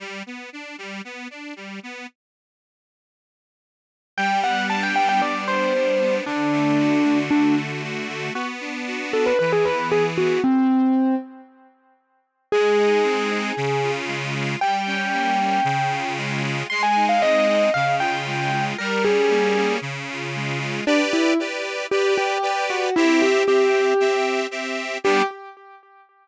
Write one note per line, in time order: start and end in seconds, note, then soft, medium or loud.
0.00 0.23 G3 medium
0.26 0.50 B3 medium
0.53 0.76 D4 medium
0.78 1.02 G3 medium
1.05 1.28 B3 medium
1.30 1.54 D4 medium
1.56 1.80 G3 medium
1.83 2.07 B3 medium
4.17 5.21 G3 medium
4.17 4.40 G5 medium
4.43 4.95 B3 medium
4.43 4.66 F#5 medium
4.69 5.74 D4 medium
4.69 4.82 A5 medium
4.83 4.95 G5 medium
4.95 5.46 B3 medium
4.95 5.08 G5 medium
5.09 5.21 G5 medium
5.21 6.20 G3 medium
5.21 5.44 D5 medium
5.47 6.00 B3 medium
5.47 6.15 C5 medium
5.74 6.24 D4 medium
6.01 6.25 B3 medium
6.26 7.30 D3 medium
6.26 7.18 D4 medium
6.52 7.03 A3 medium
6.79 7.83 F#4 medium
7.04 7.55 A3 medium
7.30 8.30 D3 medium
7.30 7.55 D4 medium
7.56 8.08 A3 medium
7.83 8.33 F#4 medium
8.09 8.33 A3 medium
8.34 9.33 B3 medium
8.34 8.47 F#4 medium
8.60 9.12 D4 medium
8.87 9.37 F#4 medium
9.13 9.38 D4 medium
9.13 9.26 A4 medium
9.26 9.38 B4 medium
9.39 10.39 E3 medium
9.39 9.51 B4 medium
9.52 9.65 G#4 medium
9.65 10.17 B3 medium
9.65 9.88 B4 medium
9.91 10.40 G#4 medium
9.91 10.04 G#4 medium
10.17 10.42 B3 medium
10.17 10.40 F#4 medium
10.44 11.15 C4 medium
12.52 13.52 G#3 medium
12.52 13.91 G#4 medium
12.79 13.30 D#4 medium
13.04 13.53 C4 medium
13.30 13.55 D#4 medium
13.57 14.56 C#3 loud
13.83 14.34 F4 medium
14.07 14.57 G#3 medium
14.35 14.60 F4 medium
14.61 15.60 G3 medium
14.61 16.13 G5 medium
14.87 15.39 C#4 medium
15.13 15.63 A#3 medium
15.40 15.65 C#4 medium
15.64 16.63 C#3 loud
15.91 16.42 F4 medium
16.17 16.67 G#3 medium
16.43 16.68 F4 medium
16.70 17.70 G#3 medium
16.70 16.82 C6 medium
16.83 17.04 G#5 medium
16.96 17.48 D#4 medium
17.09 17.21 F5 medium
17.21 17.71 C4 medium
17.21 17.70 D#5 medium
17.48 17.73 D#4 medium
17.74 18.74 C#3 medium
17.74 17.95 F5 medium
17.99 18.52 F4 medium
17.99 18.64 G5 medium
18.27 18.76 G#3 medium
18.52 18.77 F4 medium
18.78 19.78 G3 loud
18.78 19.02 A#4 medium
19.04 19.55 C#4 medium
19.04 19.74 G#4 medium
19.30 19.79 A#3 medium
19.56 19.81 C#4 medium
19.81 20.81 C#3 medium
20.09 20.59 F4 medium
20.35 20.85 G#3 medium
20.60 20.84 F4 medium
20.87 20.99 D4 medium
20.87 21.33 G4 medium
20.87 21.33 B4 medium
20.87 21.33 D5 loud
21.13 21.37 E4 medium
21.40 21.87 G4 medium
21.40 21.87 B4 medium
21.40 21.87 D5 medium
21.91 22.38 G4 medium
21.91 22.13 G4 medium
21.91 22.38 B4 medium
21.91 22.38 D5 medium
22.17 22.64 G4 medium
22.43 22.90 G4 medium
22.43 22.90 B4 medium
22.43 22.90 D5 medium
22.70 22.94 F#4 medium
22.96 23.43 C4 medium
22.96 23.19 E4 medium
22.96 23.43 G4 loud
22.96 23.43 E5 medium
23.22 23.45 G4 medium
23.47 23.94 C4 medium
23.47 23.94 G4 medium
23.47 24.40 G4 medium
23.47 23.94 E5 medium
24.00 24.47 C4 medium
24.00 24.47 G4 medium
24.00 24.47 E5 medium
24.51 24.98 C4 medium
24.51 24.98 G4 medium
24.51 24.98 E5 medium
25.04 25.22 G3 loud
25.04 25.22 B3 medium
25.04 25.22 D4 loud
25.04 25.23 G4 loud